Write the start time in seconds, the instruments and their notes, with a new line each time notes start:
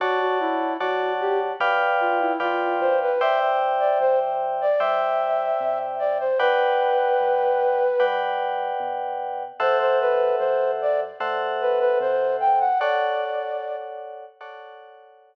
0.00 synth bass 1 D2, flute F#4, electric piano 2 C#5 D5 F#5 A5
0.20 flute F#4
0.40 flute E4
0.80 synth bass 1 F#2, flute F#4, electric piano 2 C#5 D5 F#5 A5
1.21 flute G4
1.60 synth bass 1 D2, electric piano 2 B4 D5 F5 G5
2.00 flute F4
2.20 flute E4
2.40 synth bass 1 F2, flute F4, electric piano 2 B4 D5 F5 G5
2.80 synth bass 1 D2, flute C5
3.02 flute B4
3.21 electric piano 2 C5 D5 E5 G5, flute E5
3.80 flute D5
4.00 synth bass 1 E2, flute C5
4.61 flute D5
4.79 synth bass 1 G2, electric piano 2 C5 D5 E5 G5, flute E5
5.60 synth bass 1 C3
5.99 flute D5
6.20 flute C5
6.39 synth bass 1 D2, electric piano 2 B4 D5 F#5 G5, flute B4
7.20 synth bass 1 F#2
8.00 synth bass 1 G2, electric piano 2 B4 D5 F#5 G5
8.80 synth bass 1 B2
9.60 synth bass 1 E2, electric piano 2 A4 C5 E5 F#5, flute C5
9.80 flute C5
10.01 flute B4
10.39 synth bass 1 F#2, flute C5
10.81 flute D5
11.20 synth bass 1 A2, electric piano 2 A4 C5 E5 F#5
11.61 flute B4
11.79 flute B4
12.00 synth bass 1 C3, flute C5
12.40 flute G5
12.60 flute F#5
12.80 electric piano 2 A4 C#5 D5 F#5, flute D5
14.41 electric piano 2 A4 C#5 D5 F#5